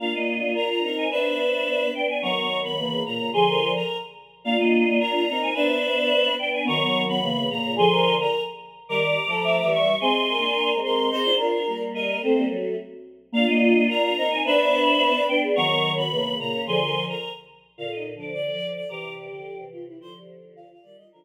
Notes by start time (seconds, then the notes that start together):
0.00 A#3 D4 F4 F5
0.14 A#3 D#5
0.41 A#3
0.55 A#4 A#5
0.69 A#5
0.83 C4 D#4 A#4
0.97 G#5
1.11 B3 D4 B4 C5 E5
1.94 B3 D4 G5
2.08 G#5
2.22 D#3 F#3 B3 A#5 C#6
2.37 B3
2.63 B3 B5
2.77 C#3 E3 A#3
3.04 A#2 C#3 A#3 A#5
3.19 A#2 C#3
3.33 D3 F3 G#4 G#5 C6
3.48 A#4
3.74 A#4 A#5
4.44 A#3 D4 F4 F5
4.56 A#3 D#5
4.86 A#3
4.99 A#4 A#5
5.14 A#5
5.27 C4 D#4 A#4
5.42 G#5
5.54 B3 D4 B4 C5 E5
6.39 B3 D4 G5
6.53 G#5
6.65 D#3 F#3 B3 A#5 C#6
6.80 B3
7.08 B3 B5
7.21 C#3 E3 A#3
7.50 A#2 C#3 A#3 A#5
7.64 A#2 C#3
7.76 D3 F3 G#4 G#5 C6
7.91 A#4
8.19 A#4 A#5
8.89 D#3 G3 A#4 A#5 D6
9.26 F3 A3 A4
9.44 E5
9.58 E5
9.63 E3 G3
9.72 C#6
10.00 G#3 C4 G#4 G#5 C6
10.29 A#4
10.37 A#3 D4
10.74 G#3 C4
10.83 A#4 C6
11.10 C4 D#4 G#4 C5
11.25 D4 F4
11.37 D4 F4 A#4
11.67 G3 A#3
11.94 A#4 D#5
12.22 A3 C4 A4 C5
12.36 G3 A#3
12.50 F#3 A3 F#4
13.32 A#3 D4 F4 F5
13.47 A#3 D#5
13.74 A#3
13.88 A#4 A#5
14.03 A#5
14.17 C4 D#4 A#4
14.31 G#5
14.44 B3 D4 B4 C5 E5
15.28 B3 D4 G5
15.42 G#4
15.56 D#3 F#3 B3 A#5 C#6
15.68 B3
15.96 B3 B5
16.11 C#3 E3 A#3
16.39 A#2 C#3 A#3 A#5
16.53 A#3 C#4
16.67 D3 F3 G#4 G#5 C6
16.80 A#4
17.08 A#4 A#5
17.78 A#2 D3 F4 F5
17.92 D#4 D#5
18.15 D3 F3 D4
18.19 D5
18.33 D5
18.52 D3 F3
18.75 D5
18.89 C3 E3 G4 A#5 D6
19.17 D5
19.30 D3 F3
19.58 C3 E3
19.72 F4
19.87 E4
20.00 D3 F3 F4 C5
20.14 G4
20.56 F4 F5
20.69 F4 F5
20.82 D#3 G3 D5
20.96 D#3 G3 F4 D#5
21.11 D3 F3 D4 F4 A#4